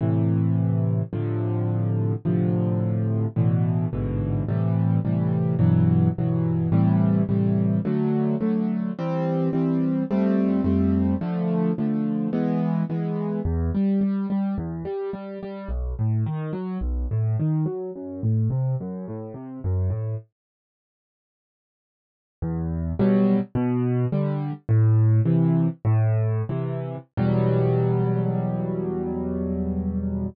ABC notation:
X:1
M:4/4
L:1/8
Q:1/4=107
K:Am
V:1 name="Acoustic Grand Piano"
[A,,C,E,]4 [A,,C,D,F,]4 | [A,,C,D,F,]4 [A,,B,,D,E,]2 [A,,,^G,,B,,D,E,]2 | [A,,C,E,G,]2 [A,,C,E,G,]2 [G,,B,,E,^F,]2 [G,,B,,E,F,]2 | [A,,C,E,G,]2 [A,,C,E,G,]2 [D,^F,A,]2 [D,F,A,]2 |
[E,G,C]2 [E,G,C]2 [F,,G,A,C]2 [F,,G,A,C]2 | [D,F,A,]2 [D,F,A,]2 [E,^G,B,]2 [E,G,B,]2 | [K:Em] E,, G, G, G, E,, G, G, G, | B,,, A,, ^D, F, B,,, A,, D, F, |
F,, A,, C, F,, A,, C, F,, A,, | z8 | E,,2 [B,,F,G,]2 B,,2 [D,G,]2 | "^rit." A,,2 [C,E,]2 A,,2 [C,E,]2 |
[E,,B,,F,G,]8 |]